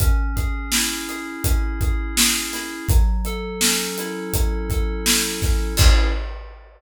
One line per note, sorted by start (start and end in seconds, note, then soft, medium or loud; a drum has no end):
0.00 1.44 C#4 loud
0.00 kick medium
0.00 closed hi-hat medium
0.36 1.08 G#4 medium
0.36 kick medium
0.36 closed hi-hat medium
0.72 2.53 E4 medium
0.72 snare loud
1.08 1.80 G#4 medium
1.08 closed hi-hat medium
1.44 2.83 C#4 medium
1.44 kick medium
1.44 closed hi-hat loud
1.81 2.16 G#4 medium
1.81 kick medium
1.81 closed hi-hat medium
2.16 2.86 G#4 medium
2.16 snare loud
2.53 2.88 E4 medium
2.53 snare soft
2.53 closed hi-hat medium
2.89 4.33 F#3 loud
2.89 kick loud
2.89 closed hi-hat medium
3.25 4.69 A4 medium
3.25 closed hi-hat medium
3.61 5.42 C#4 medium
3.61 snare loud
3.98 5.05 E4 medium
3.98 closed hi-hat medium
4.33 5.72 F#3 medium
4.33 kick medium
4.33 closed hi-hat loud
4.70 5.74 A4 medium
4.70 kick medium
4.70 closed hi-hat medium
5.06 5.75 E4 medium
5.06 snare loud
5.42 5.77 C#4 medium
5.42 kick medium
5.42 snare soft
5.42 closed hi-hat medium
5.77 6.06 C#4 loud
5.77 6.06 E4 medium
5.77 6.06 G#4 loud
5.77 kick loud
5.77 crash loud